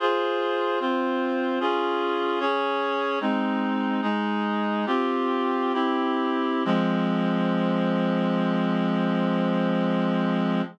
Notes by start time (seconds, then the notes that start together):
0.00 F4 G#4 C5
0.80 C4 F4 C5
1.60 C#4 F4 G#4
2.40 C#4 G#4 C#5
3.21 G#3 C4 D#4
4.02 G#3 D#4 G#4
4.86 C4 F4 G4
5.73 C4 E4 G4
6.65 F3 G#3 C4